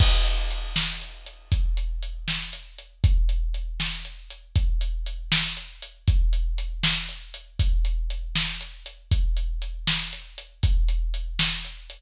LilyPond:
\new DrumStaff \drummode { \time 6/8 \tempo 4. = 79 <cymc bd>8 hh8 hh8 sn8 hh8 hh8 | <hh bd>8 hh8 hh8 sn8 hh8 hh8 | <hh bd>8 hh8 hh8 sn8 hh8 hh8 | <hh bd>8 hh8 hh8 sn8 hh8 hh8 |
<hh bd>8 hh8 hh8 sn8 hh8 hh8 | <hh bd>8 hh8 hh8 sn8 hh8 hh8 | <hh bd>8 hh8 hh8 sn8 hh8 hh8 | <hh bd>8 hh8 hh8 sn8 hh8 hh8 | }